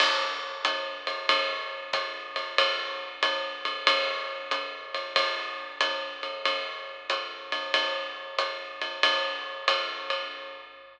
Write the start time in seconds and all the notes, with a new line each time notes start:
0.00 crash, ride
0.65 hi-hat pedal, ride
1.07 ride
1.29 ride
1.93 kick, hi-hat pedal, ride
2.36 ride
2.58 ride
3.23 hi-hat pedal, ride
3.65 ride
3.87 ride
4.51 hi-hat pedal, ride
4.94 ride
5.16 kick, ride
5.81 hi-hat pedal, ride
6.23 ride
6.45 ride
7.10 hi-hat pedal, ride
7.52 ride
7.74 ride
8.38 hi-hat pedal, ride
8.81 ride
9.03 ride
9.68 hi-hat pedal, ride
10.10 ride